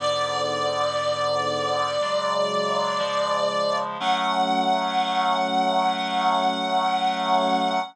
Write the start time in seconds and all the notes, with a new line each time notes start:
0.00 G#2 D3 B3 D5
2.01 C#3 F#3 G#3
2.99 C#3 F3 G#3
4.00 F#3 A3 C#4 F#5